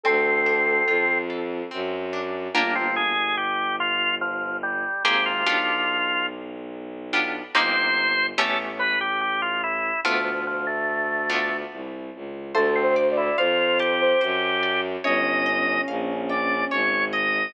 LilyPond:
<<
  \new Staff \with { instrumentName = "Ocarina" } { \time 3/4 \key d \minor \tempo 4 = 72 a'4. r4. | \key g \minor r2. | r2. | r2. |
r2. | \key d \minor \tuplet 3/2 { a'8 c''8 d''8 } c''8. c''16 r4 | des'2~ des'8 r8 | }
  \new Staff \with { instrumentName = "Drawbar Organ" } { \time 3/4 \key d \minor c'4. r4. | \key g \minor bes16 c'16 aes'8 g'8 f'8 f8 g8 | g'16 f'4~ f'16 r4. | c''4 a'16 r16 b'16 g'16 g'16 f'16 e'8 |
f16 f16 f16 a4~ a16 r4 | \key d \minor a16 c'16 r16 e'16 f'8 g'4. | ees''4 r8 d''8 des''8 ees''8 | }
  \new Staff \with { instrumentName = "Acoustic Guitar (steel)" } { \time 3/4 \key d \minor c'8 d'8 f'8 a'8 c'8 d'8 | \key g \minor <bes d' f' g'>2. | <bes c' g' aes'>8 <b d' f' g'>2 <b d' f' g'>8 | <bes c' ees' g'>4 <a b cis' g'>2 |
<a b d' f'>4. <a b d' f'>4. | \key d \minor c''8 d''8 f''8 a''8 c''8 d''8 | des''8 ees''8 f''8 g''8 des''8 ees''8 | }
  \new Staff \with { instrumentName = "Violin" } { \clef bass \time 3/4 \key d \minor d,4 f,4 ges,4 | \key g \minor g,,2. | aes,,8 b,,2~ b,,8 | g,,4 a,,2 |
d,2 c,8 cis,8 | \key d \minor d,4 f,4 ges,4 | g,,4 bes,,4 aes,,4 | }
>>